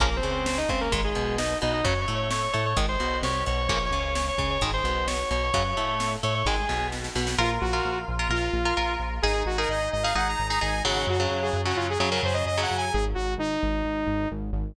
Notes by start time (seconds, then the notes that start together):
0.00 A#1 C#3 F3 A#3 A#4, kick, closed hi-hat
0.16 C4 C5
0.23 C#2 C#3, closed hi-hat
0.31 C4 C5
0.46 C4 C5, snare
0.58 D#4 D#5
0.69 C#2 C#3 C4 C5, kick, closed hi-hat
0.81 A#3 A#4
0.92 G#1 D#3 G#3, kick, closed hi-hat
1.04 G#3 G#4
1.15 B1 B2, closed hi-hat
1.38 D#4 D#5, snare
1.61 B1 B2 D#4 D#5, closed hi-hat
1.73 D#4 D#5
1.84 F#2 C#3 F#3 C#5 C#6, kick, closed hi-hat
2.01 C#5 C#6
2.08 A2 A3, closed hi-hat
2.15 C#5 C#6
2.31 C#5 C#6, snare
2.43 C#5 C#6
2.53 A2 A3 C#5 C#6, closed hi-hat
2.66 C#5 C#6
2.77 G#1 D#3 G#3, kick, closed hi-hat
2.89 C5 C6
3.00 B1 B2, closed hi-hat
3.23 C2 C3 C#5 C#6, snare
3.46 B1 B2 C#5 C#6, closed hi-hat
3.57 C#5 C#6
3.68 A#1 C#3 F3 A#3 C#5 C#6, kick, closed hi-hat
3.86 C#5 C#6
3.91 C#2 C#3, closed hi-hat
3.99 C#5 C#6
4.15 C#5 C#6, snare
4.29 C#5 C#6
4.38 C#2 C#3 C#5 C#6, kick, closed hi-hat
4.50 C#5 C#6
4.61 G#1 D#3 G#3, kick, closed hi-hat
4.73 C5 C6
4.84 B1 B2, closed hi-hat
5.07 C#5 C#6, snare
5.30 B1 B2 C#5 C#6, closed hi-hat
5.43 C#5 C#6
5.54 F#2 C#3 F#3 C#5 C#6, kick, closed hi-hat
5.77 A2 A3, closed hi-hat
6.00 snare
6.23 A2 A3 C#5 C#6, closed hi-hat
6.35 C#5 C#6
6.45 G#1 D#3 G#3 G#4 G#5, kick, snare
6.69 B1 B2, snare
6.92 snare
7.04 snare
7.15 B1 B2, snare
7.27 snare
7.38 A#1 F4 A#4
7.61 A#1 F#4
7.73 F4 A#4
7.85 A#1
8.08 A#1
8.19 F4 A#4
8.29 A#1 F4 A#4
8.53 A#1
8.65 F4 A#4
8.77 A#1 F4 A#4
9.00 A#1
9.22 G#1 D#4 G#4
9.46 G#1 F#4
9.58 D#4 G#4 A#4
9.69 G#1 D#5
9.92 G#1 D#5
10.03 D#4 G#4 F5
10.15 G#1 D#4 G#4 F#5
10.28 A#5
10.39 G#1
10.49 D#4 G#4 A#5
10.61 G#1 D#4 G#4 G#5
10.85 G#1 C#3 F#3 F#5
11.07 F#2 F#4
11.20 C#3 F#3
11.31 F#2
11.42 G#4
11.53 F#2
11.65 C#3 F#3 F#4
11.76 F#2 F4
11.90 G#4
11.99 F#2 C#3 F#3 G#4
12.11 C#3 F#3 A#4
12.23 F#2 C5
12.34 D#5
12.46 F#2 D#5
12.57 C#3 F#3
12.62 F#5
12.71 F#2
12.77 G#5
12.93 G#1 G#4
13.15 G#1 F#4
13.38 G#1 D#4
13.63 G#1
13.85 G#1
14.07 G#1
14.31 G#1
14.53 G#1